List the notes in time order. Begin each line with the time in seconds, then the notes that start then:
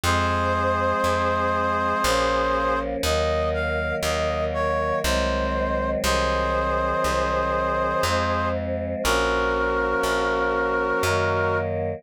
0.04 F2 F3 G#3 C4 G#4 C5
1.04 F2
2.03 A#1 F3 A#3 C#4
3.03 D#2 D#3 F#3 A#3 D#5
3.54 F5
4.03 D#2 D#5
4.54 C#5
5.04 C2 D#3 F#3 G#3 C4 C5
6.04 C2 D#3 F#3 C4 G#4 C5
7.04 C2
8.03 F2 F3 G#3 C4
9.03 A#1 F3 A#3 C#4 F#4 A#4
10.03 A#1
11.03 F#2 D#3 F#3 A#3